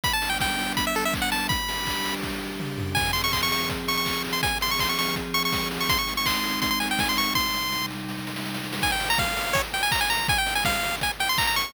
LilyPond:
<<
  \new Staff \with { instrumentName = "Lead 1 (square)" } { \time 4/4 \key e \minor \tempo 4 = 164 b''16 a''8 g''16 g''4 b''16 e''16 a'16 e''16 r16 fis''16 a''8 | b''2 r2 | \key f \minor aes''8 c'''16 des'''16 c'''16 des'''16 des'''8 r8 des'''16 des'''8. r16 c'''16 | aes''8 c'''16 des'''16 c'''16 des'''16 des'''8 r8 des'''16 des'''8. r16 des'''16 |
c'''16 des'''8 des'''16 c'''4 c'''16 c'''16 aes''16 g''16 aes''16 c'''16 des'''8 | c'''4. r2 r8 | aes''16 g''8 bes''16 f''4 des''16 r16 g''16 aes''16 bes''16 aes''16 bes''8 | aes''16 g''8 aes''16 f''4 aes''16 r16 g''16 c'''16 bes''16 bes''16 des'''8 | }
  \new Staff \with { instrumentName = "Pad 5 (bowed)" } { \time 4/4 \key e \minor <g b d'>1 | <g d' g'>1 | \key f \minor <f c' aes'>1 | <f c' aes'>1 |
<aes c' ees'>1 | <c g ees'>1 | r1 | r1 | }
  \new DrumStaff \with { instrumentName = "Drums" } \drummode { \time 4/4 <hh bd>8 hho8 <bd sn>8 hho8 <hh bd>8 hho8 <hc bd>8 hho8 | <hh bd>8 hho8 <hc bd>8 hho8 <bd sn>4 toml8 tomfh8 | <cymc bd>8 hho8 <hc bd>8 hho8 <hh bd>8 hho8 <hc bd>8 hho8 | <hh bd>8 hho8 <hc bd>8 hho8 <hh bd>8 hho8 <bd sn>8 hho8 |
<hh bd>8 hho8 <hc bd>8 hho8 <hh bd>8 hho8 <bd sn>8 hho8 | <bd sn>8 sn8 sn8 sn8 sn16 sn16 sn16 sn16 sn16 sn16 sn16 sn16 | <cymc bd>8 hho8 <bd sn>8 hho8 <hh bd>8 hho8 <hc bd>8 hho8 | <hh bd>8 hho8 <bd sn>8 hho8 <hh bd>8 hho8 <hc bd>8 hho8 | }
>>